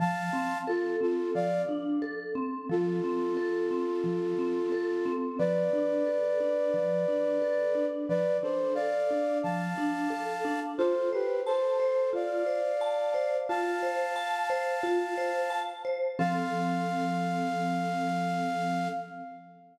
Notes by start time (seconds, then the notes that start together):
0.00 F3 F5 A5
0.33 C4
0.67 F4 A4
1.01 C4 F4 A4
1.35 F3 D5 F5
1.69 D4
2.02 A4
2.35 C4
2.69 F3 F4 A4
3.04 C4
3.37 A4
3.71 C4
4.04 F3
4.39 C4
4.72 A4
5.05 C4
5.39 F3 B4 D5
5.73 D4
6.06 A4
6.40 D4
6.74 F3
7.08 D4
7.42 A4
7.75 D4
8.09 F3 B4 D5
8.43 D4 A4 C5
8.75 A4 D5 F5
9.11 D4
9.43 F3 F5 A5
9.78 D4
10.10 A4
10.45 D4
10.78 F4 A4 C5
11.13 G4 B4 C5
11.46 A4 C5 A5
11.80 C5
12.13 F4 D5 F5
12.46 C5
12.81 A5
13.14 C5
13.49 F4 F5 A5
13.83 C5
14.16 A5
14.50 C5
14.83 F4
15.18 C5
15.50 A5
15.85 C5
16.19 F3 C4 A4 F5